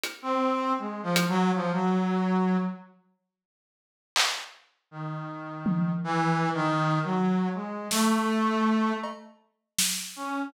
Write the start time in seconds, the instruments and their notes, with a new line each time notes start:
0.03 closed hi-hat
0.22 brass section C4
0.78 brass section G#3
1.03 brass section F3
1.16 closed hi-hat
1.29 brass section F#3
1.54 brass section F3
1.73 brass section F#3
4.16 clap
4.91 brass section D#3
5.66 high tom
6.04 brass section E3
6.54 brass section D#3
7.04 brass section F#3
7.54 brass section G#3
7.91 brass section A3, snare
9.03 cowbell
9.78 snare
10.16 brass section C#4